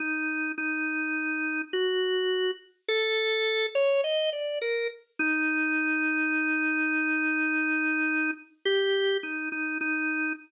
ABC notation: X:1
M:9/8
L:1/16
Q:3/8=35
K:none
V:1 name="Drawbar Organ"
_E2 E4 _G3 z A3 _d _e =d _B z | _E12 G2 E E E2 |]